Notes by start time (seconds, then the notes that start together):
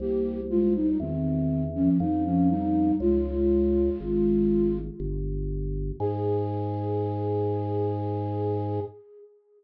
0.00 C2 A#3 G4
0.50 G#3 F4
0.75 G3 D#4
1.00 E2 D#3 C4
1.75 F3 C#4
2.00 F2 G3 D#4
2.25 F3 C#4
2.50 G3 D#4
3.00 C#2 G#3 F4
4.00 G#1
5.00 G1
6.00 G#2 G#4